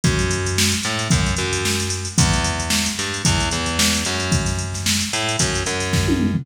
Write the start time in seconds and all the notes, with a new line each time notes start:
0.04 F#2, kick, closed hi-hat
0.19 closed hi-hat
0.31 closed hi-hat
0.46 closed hi-hat
0.58 snare
0.72 closed hi-hat
0.83 A2, closed hi-hat
0.99 closed hi-hat
1.10 F#2, kick, closed hi-hat
1.26 closed hi-hat
1.36 F#2, closed hi-hat
1.53 closed hi-hat
1.65 snare
1.80 closed hi-hat
1.90 closed hi-hat
2.05 closed hi-hat
2.18 E2, kick, closed hi-hat
2.33 closed hi-hat
2.44 closed hi-hat
2.60 closed hi-hat
2.70 snare
2.86 snare, closed hi-hat
2.99 G2, closed hi-hat
3.14 closed hi-hat
3.25 E2, kick, closed hi-hat
3.40 closed hi-hat
3.51 E2, closed hi-hat
3.66 closed hi-hat
3.79 snare
3.94 closed hi-hat
4.05 F#2, closed hi-hat
4.20 closed hi-hat
4.32 kick, closed hi-hat
4.46 snare, closed hi-hat
4.59 closed hi-hat
4.74 snare, closed hi-hat
4.86 snare
5.01 closed hi-hat
5.13 A2, closed hi-hat
5.29 closed hi-hat
5.39 F#2, kick, closed hi-hat
5.55 closed hi-hat
5.66 F#2, closed hi-hat
5.80 snare, closed hi-hat
5.93 kick, snare
6.08 high tom
6.20 mid tom
6.34 floor tom